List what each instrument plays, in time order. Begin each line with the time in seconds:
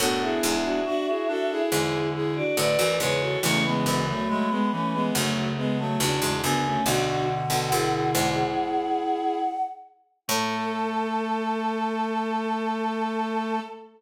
0.00 harpsichord F#2 A2, clarinet B3 D4, violin F#4 A4, choir aahs F#5
0.21 violin E4 G#4, choir aahs E5
0.43 harpsichord E2 G#2, choir aahs E5
0.64 violin D4 F#4
0.86 violin D4 F#4, clarinet F#4
1.07 violin E4 G#4, clarinet F#4
1.28 clarinet D4, violin F#4 A4
1.50 violin E4 G#4
1.71 harpsichord E2 G#2, clarinet D3, violin E4 G#4
2.14 violin E4 G#4
2.36 violin D4 F#4, choir aahs D5
2.57 harpsichord F#2 A2, clarinet D3, violin B4 D5, choir aahs D5
2.79 harpsichord D2 F#2, clarinet E3
3.00 harpsichord E2 G#2, clarinet C#3, violin G#4 B4, choir aahs C#5
3.21 violin F#4 A4
3.43 harpsichord C#2 E2, clarinet C#3 E3, violin A3 C#4, choir aahs C#6
3.64 violin G#3 B3, choir aahs B5
3.86 harpsichord D2 F#2, choir aahs B5
4.08 violin F#3 A3
4.29 violin F#3 A3, clarinet G#3
4.50 violin G#3 B3, clarinet G#3
4.72 clarinet E3, violin A3 C#4
4.93 violin G#3 B3
5.14 harpsichord D2 F#2, clarinet C#3, violin F#3 A3
5.57 violin G#3 B3
5.78 violin F#3 A3, choir aahs A5
5.99 harpsichord C#2 E2, clarinet C#3, violin D4 F#4, choir aahs A5
6.21 harpsichord E2 G#2, clarinet C#3
6.42 harpsichord D2 F#2, clarinet C#3, violin B3 D4, choir aahs G#5
6.64 violin A3 C#4
6.86 harpsichord B1 D2, clarinet B2 D3, violin D4 F#4, choir aahs F#5
7.07 choir aahs F#5
7.50 harpsichord B1 D2, violin F#4 A4
7.71 harpsichord D2 F#2, violin E4 G#4
7.93 violin E4 G#4
8.15 harpsichord E2 G#2
10.28 harpsichord A2, clarinet A3, violin A4, choir aahs A5